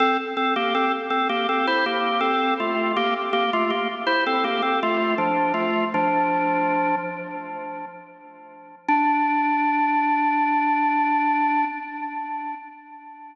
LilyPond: \new Staff { \time 4/4 \key d \minor \tempo 4 = 81 <c' a'>16 r16 <c' a'>16 <bes g'>16 <c' a'>16 r16 <c' a'>16 <bes g'>16 <c' a'>16 <e' c''>16 <bes g'>8 <c' a'>8 <a f'>8 | <bes g'>16 r16 <bes g'>16 <a f'>16 <bes g'>16 r16 <e' c''>16 <c' a'>16 <bes g'>16 <c' a'>16 <a f'>8 <f d'>8 <a f'>8 | <f d'>4. r2 r8 | d'1 | }